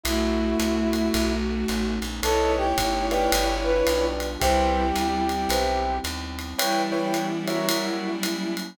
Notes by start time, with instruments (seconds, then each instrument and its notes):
0.03 electric bass (finger) B1, pad 5 (bowed) A3 B3 E4 F#4, violin A3 F#4, brass section E4, ride
0.60 electric bass (finger) C2, hi-hat pedal, ride
0.93 ride
1.14 electric bass (finger) B1, pad 5 (bowed) A3 B3 C#4 D#4, kick, ride
1.68 electric bass (finger) A1, hi-hat pedal, ride
2.02 electric bass (finger) A#1, ride
2.23 electric bass (finger) B1, pad 5 (bowed) A3 B3 C#4 D#4, violin E4 C#5, acoustic grand piano A4 B4 C#5 D#5, brass section A4, ride
2.57 brass section G4
2.78 electric bass (finger) G1, kick, hi-hat pedal, ride
3.11 acoustic grand piano G4 B4 D5 F5, brass section G4, ride
3.32 electric bass (finger) G1, pad 5 (bowed) G3 B3 D4 F4, ride
3.63 brass section B4
3.86 electric bass (finger) B1, acoustic grand piano G4 B4 D5 F5, hi-hat pedal, ride
4.20 ride
4.39 electric bass (finger) C2, violin G3 E4, pad 5 (bowed) G3 B3 C4 E4, brass section G4, acoustic grand piano G4 B4 C5 E5, kick, ride
4.96 electric bass (finger) D2, hi-hat pedal, ride
5.29 violin G3 E4, ride
5.49 electric bass (finger) B1, acoustic grand piano G4 B4 C5 E5, ride
6.04 electric bass (finger) D#2, hi-hat pedal, ride
6.39 ride
6.58 pad 5 (bowed) E3 B3 C#4 G4, violin G3 E4, acoustic grand piano E4 B4 C#5 G5, ride
6.92 acoustic grand piano E4 B4 C#5 G5
7.14 hi-hat pedal, ride
7.48 acoustic grand piano F#4 A#4 C#5 E5, ride
7.69 pad 5 (bowed) F#3 A#3 C#4 E4, ride
8.23 hi-hat pedal, ride
8.57 ride